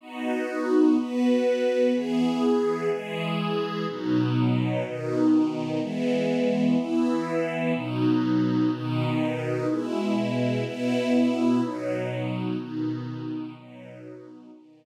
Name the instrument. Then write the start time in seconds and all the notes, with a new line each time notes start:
string ensemble 1
0.01 B3 D#4 F#4
0.97 B3 F#4 B4
1.93 E3 B3 G#4
2.90 E3 G#3 G#4
3.88 B2 F#3 D#4
4.84 B2 D#3 D#4
5.81 E3 G#3 B3
6.77 E3 B3 E4
7.74 B2 F#3 D#4
8.71 B2 D#3 D#4
9.68 B2 G#3 E4
10.65 B2 B3 E4
11.61 B2 F#3 D#4
12.58 B2 D#3 D#4
13.55 B2 F#3 D#4
14.51 B2 D#3 D#4